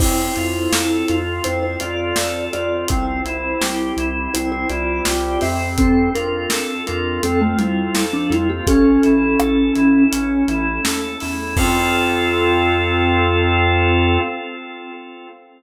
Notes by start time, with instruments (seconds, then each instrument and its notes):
0.00 synth bass 1 F2, drawbar organ C4, pad 2 (warm) C4 F4 A4, vibraphone E4 C5, kick, crash
0.36 synth bass 1 F2, drawbar organ F4, closed hi-hat
0.72 synth bass 1 F2, drawbar organ A4, snare
1.08 synth bass 1 F2, drawbar organ F4, closed hi-hat
1.44 synth bass 1 F2, drawbar organ C4, pad 2 (warm) C4 A4 C5, vibraphone E4 C5, closed hi-hat
1.63 vibraphone E4 C5
1.80 synth bass 1 F2, drawbar organ F4, vibraphone F4 D5, closed hi-hat
2.16 synth bass 1 F2, drawbar organ A4, snare
2.53 synth bass 1 F2, vibraphone F4 D5, drawbar organ F4, closed hi-hat
2.88 synth bass 1 C2, pad 2 (warm) C4 E4 G4, drawbar organ C4, vibraphone E4 C5, kick, closed hi-hat
3.24 synth bass 1 C2, drawbar organ E4, closed hi-hat
3.60 synth bass 1 C2, drawbar organ G4, snare
3.97 synth bass 1 C2, drawbar organ E4, closed hi-hat
4.34 synth bass 1 C2, drawbar organ C4, pad 2 (warm) C4 G4 C5, vibraphone E4 C5, closed hi-hat
4.52 vibraphone E4 C5
4.70 synth bass 1 C2, drawbar organ E4, vibraphone F4 D5, closed hi-hat
5.05 synth bass 1 C2, drawbar organ G4, snare
5.41 synth bass 1 F2, drawbar organ C4, vibraphone G4 E5, open hi-hat
5.78 pad 2 (warm) C4 F4 A4, vibraphone C4 A4, kick, closed hi-hat
6.14 synth bass 1 F2, vibraphone D4 A#4, drawbar organ F4, closed hi-hat
6.50 synth bass 1 F2, drawbar organ A4, snare
6.87 synth bass 1 F2, vibraphone D4 A#4, drawbar organ F4, closed hi-hat
7.23 synth bass 1 F2, vibraphone C4 A4, drawbar organ C4, pad 2 (warm) C4 A4 C5, closed hi-hat
7.41 vibraphone A3 F4
7.58 synth bass 1 F2, vibraphone G3 E4, drawbar organ F4, closed hi-hat
7.95 synth bass 1 F2, drawbar organ A4, snare
8.13 vibraphone F3 D4
8.30 synth bass 1 F2, vibraphone G3 E4, drawbar organ F4, closed hi-hat
8.49 vibraphone A#3 G4
8.67 synth bass 1 A1, vibraphone C#4 A4, pad 2 (warm) C#4 E4 A4, drawbar organ C#4, kick, closed hi-hat
9.03 synth bass 1 A1, drawbar organ E4, closed hi-hat
9.39 synth bass 1 A1, drawbar organ A4, cross-stick
9.75 synth bass 1 A1, drawbar organ E4, closed hi-hat
10.11 synth bass 1 A1, pad 2 (warm) A3 C#4 A4, drawbar organ C#4, closed hi-hat
10.48 synth bass 1 A1, drawbar organ E4, closed hi-hat
10.84 synth bass 1 D#2, drawbar organ A4, snare
11.20 synth bass 1 E2, drawbar organ E4, open hi-hat
11.56 synth bass 1 F2, pad 2 (warm) C4 F4 A4, drawbar organ C4 F4 A4, vibraphone F4, kick, crash